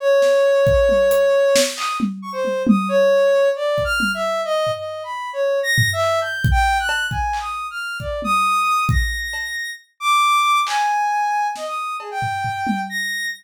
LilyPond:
<<
  \new Staff \with { instrumentName = "Ocarina" } { \time 6/4 \tempo 4 = 135 des''1 ees'''8 r8 des'''16 c''8. | ees'''8 des''4. \tuplet 3/2 { d''4 f'''4 e''4 ees''4 ees''4 b''4 } | \tuplet 3/2 { des''4 bes'''4 e''4 g'''4 g''4 ges'''4 aes''4 ees'''4 f'''4 } | d''8 ees'''4. bes'''2 r8 d'''4. |
aes''2 ees''16 ees'''8. aes'16 g''4.~ g''16 bes'''4 | }
  \new DrumStaff \with { instrumentName = "Drums" } \drummode { \time 6/4 r8 sn8 r8 bd8 tommh8 hh8 r8 sn8 hc8 tommh8 r8 tommh8 | tommh4 r4 r8 bd8 tommh4 r8 tomfh8 r4 | r4 tomfh8 hc8 cb8 bd8 r8 cb8 bd8 hc8 r4 | bd8 tommh8 r4 bd4 cb4 r4 r4 |
hc4 r4 sn4 cb8 tomfh8 tomfh8 tommh8 r4 | }
>>